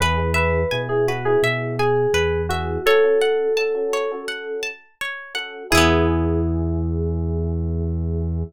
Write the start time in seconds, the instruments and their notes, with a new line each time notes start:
0.00 synth bass 1 E2, electric piano 1 B3 E4 G#4, electric piano 2 B4, acoustic guitar (steel) B4
0.17 electric piano 1 B3 E4 G#4
0.34 electric piano 2 B4, acoustic guitar (steel) E5
0.71 synth bass 1 B2, electric piano 1 B3 E4 G#4, acoustic guitar (steel) G#5
0.89 electric piano 1 B3 E4 G#4, electric piano 2 G#4
1.08 electric piano 2 F#4, acoustic guitar (steel) B4
1.25 electric piano 1 B3 E4 G#4, electric piano 2 G#4
1.42 synth bass 1 B2, acoustic guitar (steel) E5
1.79 electric piano 2 G#4, acoustic guitar (steel) G#5
2.14 synth bass 1 E2, acoustic guitar (steel) B4
2.49 electric piano 1 B3 E4 G#4, electric piano 2 F#4, acoustic guitar (steel) E5
2.86 electric piano 1 C#4 F#4 A4, electric piano 2 A4, acoustic guitar (steel) C#5
3.04 electric piano 1 C#4 F#4 A4
3.21 acoustic guitar (steel) F#5
3.57 electric piano 1 C#4 F#4 A4, acoustic guitar (steel) A5
3.75 electric piano 1 C#4 F#4 A4
3.93 acoustic guitar (steel) C#5
4.11 electric piano 1 C#4 F#4 A4
4.28 acoustic guitar (steel) F#5
4.63 acoustic guitar (steel) A5
5.01 acoustic guitar (steel) C#5
5.35 electric piano 1 C#4 F#4 A4, acoustic guitar (steel) F#5
5.70 synth bass 1 E2, electric piano 1 B3 E4 G#4, electric piano 2 E4, acoustic guitar (steel) G#4
5.75 acoustic guitar (steel) B3 E4